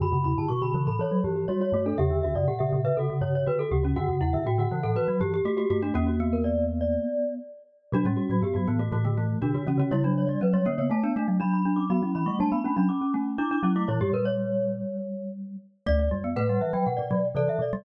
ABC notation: X:1
M:4/4
L:1/16
Q:1/4=121
K:Bm
V:1 name="Glockenspiel"
b2 b a c' b2 b c2 z2 c c2 A | e2 e d f e2 e F2 z2 F F2 F | f2 f e g f2 f F2 z2 G G2 F | F F2 ^A d2 z d5 z4 |
F2 F F G F2 F F2 z2 F F2 F | c2 c d B c2 c a2 z2 b b2 d' | b2 b c' a b2 b d'2 z2 d' d'2 d' | c2 B c7 z6 |
[K:D] z d z2 f f e g f d3 d e d2 |]
V:2 name="Glockenspiel"
F2 E2 F F2 A A2 G G F F F D | G2 F2 G G2 B A2 c c B A G C | F2 E2 F F2 A B2 G G F F F D | ^A,10 z6 |
D C3 B,2 B, A, A, A, A,2 D2 C C | E D3 C2 C B, A, D D2 D2 D C | F E3 D2 D C C C C2 E2 E E | E G ^A c9 z4 |
[K:D] d4 B8 A4 |]
V:3 name="Glockenspiel"
D, C,2 D, z D, E,2 E, F, E,2 G,2 A,2 | C, D,2 C, z C, C,2 C, C, C,2 D,2 C,2 | D, C,2 D, z D, E,2 E, F, E,2 A,2 A,2 | C2 B,10 z4 |
F, G,2 F, z F, E,2 E, D, E,2 D,2 C,2 | G, F,2 G, z G, ^A,2 =A, B, A,2 D2 D2 | B, C2 A, G, B, C D z4 D D C A, | E, G,13 z2 |
[K:D] A,2 G, B, A, G, E, F, z2 F, z E, E, z G, |]
V:4 name="Marimba"
F,, F,, E,, G,, B,,2 C, A,, z2 G,,2 z2 G,,2 | E,, E,, D,, F,, ^A,,2 A,, B,, z2 G,,2 z2 D,,2 | F,, F,, E,, G,, A,,2 C, A,, z2 G,,2 z2 G,,2 | E,,10 z6 |
B,, A,, z A,, G,, G,, A,,2 A,,4 B,, D, E, D, | C,4 F,2 D, C, A,2 A, F, F,4 | F, F, E, G, A,2 A, F, z2 A,2 z2 F,2 | ^A,, G,, A,,6 z8 |
[K:D] D,,2 F,,2 A,,2 z2 B,, B,, B,,2 =C, z B,,2 |]